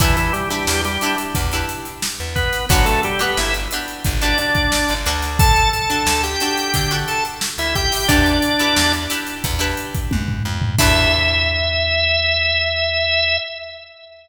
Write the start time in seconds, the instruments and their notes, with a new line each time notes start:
0.00 electric bass (finger) E2, drawbar organ E3 E4, acoustic guitar (steel) D4 E4 G4 B4, kick, closed hi-hat
0.17 drawbar organ E3 E4, closed hi-hat
0.33 drawbar organ G3 G4, closed hi-hat
0.50 drawbar organ G3 G4, acoustic guitar (steel) D4 E4 G4 B4, snare, closed hi-hat
0.67 electric bass (finger) E2, snare
0.84 drawbar organ G3 G4, snare, closed hi-hat
1.01 acoustic guitar (steel) D4 E4 G4 B4, closed hi-hat
1.18 closed hi-hat
1.35 electric bass (finger) E2, kick, closed hi-hat
1.51 acoustic guitar (steel) D4 E4 G4 B4, snare, closed hi-hat
1.69 closed hi-hat
1.85 closed hi-hat
2.02 snare
2.20 electric bass (finger) E2
2.35 drawbar organ B3 B4, kick, closed hi-hat
2.53 snare, closed hi-hat
2.69 electric bass (finger) G1, drawbar organ F#3 F#4, acoustic guitar (steel) D4 F#4 G4 B4, kick, closed hi-hat
2.86 drawbar organ A3 A4, closed hi-hat
3.03 drawbar organ G3 G4, closed hi-hat
3.19 drawbar organ B3 B4, acoustic guitar (steel) D4 F#4 G4 B4, snare, closed hi-hat
3.37 electric bass (finger) G1, drawbar organ E4 E5, snare
3.54 closed hi-hat
3.71 acoustic guitar (steel) D4 F#4 G4 B4, closed hi-hat
3.88 closed hi-hat
4.04 electric bass (finger) G1, kick, closed hi-hat
4.21 acoustic guitar (steel) D4 F#4 G4 B4, drawbar organ D4 D5, snare, closed hi-hat
4.38 drawbar organ D4 D5, snare, closed hi-hat
4.55 kick, closed hi-hat
4.72 snare
4.89 electric bass (finger) G1, closed hi-hat
5.06 electric bass (finger) D2, acoustic guitar (steel) D4 F#4 A4, closed hi-hat
5.22 snare, closed hi-hat
5.39 drawbar organ A4 A5, kick, closed hi-hat
5.56 closed hi-hat
5.73 drawbar organ A4 A5, closed hi-hat
5.90 acoustic guitar (steel) D4 F#4 A4, closed hi-hat
6.06 electric bass (finger) D2, snare
6.23 drawbar organ G4 G5, closed hi-hat
6.40 acoustic guitar (steel) D4 F#4 A4, closed hi-hat
6.57 closed hi-hat
6.74 electric bass (finger) D3, kick, closed hi-hat
6.91 acoustic guitar (steel) D4 F#4 A4, closed hi-hat
7.08 drawbar organ A4 A5, closed hi-hat
7.25 closed hi-hat
7.41 snare
7.58 electric bass (finger) D2, drawbar organ E4 E5, closed hi-hat
7.75 drawbar organ G4 G5, kick, closed hi-hat
7.92 snare, open hi-hat
8.08 electric bass (finger) E2, drawbar organ D4 D5, acoustic guitar (steel) D4 E4 G4 B4, kick, closed hi-hat
8.26 closed hi-hat
8.42 closed hi-hat
8.59 acoustic guitar (steel) D4 E4 G4 B4, closed hi-hat
8.76 electric bass (finger) E2, snare
8.93 closed hi-hat
9.10 acoustic guitar (steel) D4 E4 G4 B4, closed hi-hat
9.27 closed hi-hat
9.44 electric bass (finger) E2, kick, closed hi-hat
9.59 acoustic guitar (steel) D4 E4 G4 B4, closed hi-hat
9.77 closed hi-hat
9.95 kick, closed hi-hat
10.11 electric bass (finger) F#2, kick, high tom
10.28 floor tom
10.45 electric bass (finger) F2
10.62 floor tom
10.79 electric bass (finger) E2, acoustic guitar (steel) D4 E4 G4 B4, drawbar organ E5, kick, crash